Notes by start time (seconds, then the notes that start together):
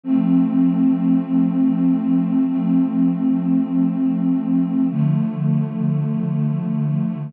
0.03 F3 A3 C4
2.47 F3 A3 C4
4.90 D3 F3 A3